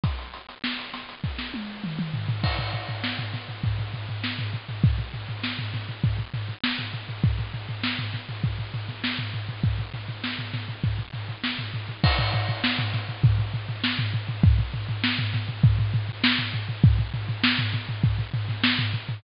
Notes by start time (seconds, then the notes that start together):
0.04 kick, closed hi-hat
0.19 closed hi-hat
0.34 closed hi-hat
0.49 snare, closed hi-hat
0.64 snare
0.79 closed hi-hat
0.94 snare, closed hi-hat
1.09 snare, closed hi-hat
1.24 kick
1.39 snare
1.54 high tom
1.84 mid tom
1.99 mid tom
2.14 floor tom
2.29 floor tom
2.44 kick, crash
2.59 floor tom
2.73 floor tom
2.89 floor tom
3.04 snare
3.19 floor tom
3.34 snare, floor tom
3.48 floor tom
3.64 kick, floor tom
3.79 floor tom
3.94 floor tom
4.09 floor tom
4.24 snare
4.39 floor tom
4.54 floor tom
4.69 floor tom
4.84 kick, floor tom
4.99 floor tom
5.14 floor tom
5.29 floor tom
5.44 snare
5.59 floor tom
5.74 snare, floor tom
5.89 floor tom
6.04 kick, floor tom
6.19 floor tom
6.34 floor tom
6.49 floor tom
6.64 snare
6.79 floor tom
6.94 floor tom
7.09 floor tom
7.24 kick, floor tom
7.39 floor tom
7.54 floor tom
7.69 floor tom
7.83 snare
7.99 floor tom
8.14 snare, floor tom
8.29 floor tom
8.44 kick, floor tom
8.59 floor tom
8.74 floor tom
8.89 snare, floor tom
9.04 snare
9.19 floor tom
9.34 floor tom
9.49 floor tom
9.63 kick, floor tom
9.79 floor tom
9.94 floor tom
10.09 floor tom
10.24 snare
10.39 snare, floor tom
10.54 snare, floor tom
10.69 floor tom
10.84 kick, floor tom
10.98 floor tom
11.14 floor tom
11.29 floor tom
11.44 snare
11.59 floor tom
11.74 floor tom
11.89 floor tom
12.04 kick, crash
12.19 floor tom
12.34 floor tom
12.49 floor tom
12.64 snare
12.79 floor tom
12.94 snare, floor tom
13.09 floor tom
13.23 kick, floor tom
13.38 floor tom
13.54 floor tom
13.69 floor tom
13.84 snare
13.99 floor tom
14.14 floor tom
14.29 floor tom
14.44 kick, floor tom
14.59 floor tom
14.74 floor tom
14.89 floor tom
15.04 snare
15.19 floor tom
15.34 snare, floor tom
15.49 floor tom
15.63 kick, floor tom
15.79 floor tom
15.94 floor tom
16.09 floor tom
16.24 snare
16.39 floor tom
16.54 floor tom
16.69 floor tom
16.84 kick, floor tom
16.99 floor tom
17.14 floor tom
17.29 floor tom
17.43 snare
17.59 floor tom
17.73 snare, floor tom
17.89 floor tom
18.04 kick, floor tom
18.18 floor tom
18.34 floor tom
18.48 snare, floor tom
18.64 snare
18.79 floor tom
18.93 floor tom
19.09 floor tom